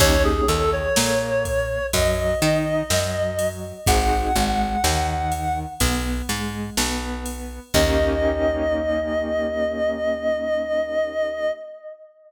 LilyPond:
<<
  \new Staff \with { instrumentName = "Clarinet" } { \time 4/4 \key ees \major \tempo 4 = 62 des''16 aes'16 a'16 des''4~ des''16 ees''2 | ges''2 r2 | ees''1 | }
  \new Staff \with { instrumentName = "Acoustic Grand Piano" } { \time 4/4 \key ees \major <bes des' ees' g'>8 ees8 bes4 ges8 ees'8 ges4 | <c' ees' ges' aes'>8 aes8 ees4 b8 aes8 b4 | <bes des' ees' g'>1 | }
  \new Staff \with { instrumentName = "Electric Bass (finger)" } { \clef bass \time 4/4 \key ees \major ees,8 ees,8 bes,4 ges,8 ees8 ges,4 | aes,,8 aes,,8 ees,4 b,,8 aes,8 b,,4 | ees,1 | }
  \new DrumStaff \with { instrumentName = "Drums" } \drummode { \time 4/4 <cymc bd>8 cymr8 sn8 <bd cymr>8 <bd cymr>8 cymr8 sn8 cymr8 | <bd cymr>8 cymr8 sn8 cymr8 <bd cymr>8 cymr8 sn8 cymr8 | <cymc bd>4 r4 r4 r4 | }
>>